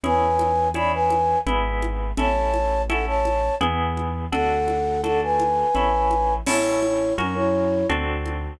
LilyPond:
<<
  \new Staff \with { instrumentName = "Flute" } { \time 3/4 \key a \major \tempo 4 = 84 <b' gis''>4 <d'' b''>16 <b' gis''>8. r4 | <cis'' a''>4 <a' fis''>16 <cis'' a''>8. r4 | <a' fis''>4 <a' fis''>16 <b' gis''>4.~ <b' gis''>16 | <e' cis''>4 <cis' ais'>16 <e' cis''>8. r4 | }
  \new Staff \with { instrumentName = "Orchestral Harp" } { \time 3/4 \key a \major <cis' e' gis'>4 <cis' e' gis'>4 <b e' gis'>4 | <cis' e' a'>4 <cis' e' a'>4 <b e' gis'>4 | <d' fis' a'>4 <d' fis' a'>4 <cis' e' a'>4 | <cis' e' a'>4 <cis' fis' ais'>4 <c' d' fis' a'>4 | }
  \new Staff \with { instrumentName = "Acoustic Grand Piano" } { \clef bass \time 3/4 \key a \major e,2 gis,,4 | a,,2 e,4 | d,2 a,,4 | a,,4 fis,4 d,4 | }
  \new DrumStaff \with { instrumentName = "Drums" } \drummode { \time 3/4 cgl8 cgho8 cgho8 cgho8 cgl8 cgho8 | cgl8 cgho8 cgho8 cgho8 cgl8 cgho8 | cgl8 cgho8 cgho8 cgho8 cgl8 cgho8 | <cgl cymc>8 cgho8 cgho4 cgl8 cgho8 | }
>>